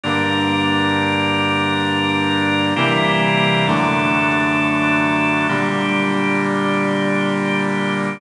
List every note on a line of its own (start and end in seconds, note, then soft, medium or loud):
0.04 2.74 G2 loud
0.04 2.74 D3 medium
0.04 2.74 G3 medium
0.04 2.74 A#3 medium
0.04 2.74 D4 medium
0.04 2.74 A#4 medium
2.76 3.66 C3 loud
2.76 3.66 E3 medium
2.76 3.66 G3 medium
2.76 3.66 A#3 medium
2.76 3.66 C4 medium
2.76 3.66 E4 medium
2.76 3.66 G4 medium
2.76 3.66 A#4 medium
3.67 5.47 F#2 medium
3.67 5.47 D3 loud
3.67 5.47 F#3 medium
3.67 5.47 A3 medium
3.67 5.47 D4 medium
3.67 5.47 A4 medium
5.49 8.19 A#2 medium
5.49 8.19 D3 medium
5.49 8.19 G3 loud
5.49 8.19 A#3 medium
5.49 8.19 D4 medium
5.49 8.19 G4 medium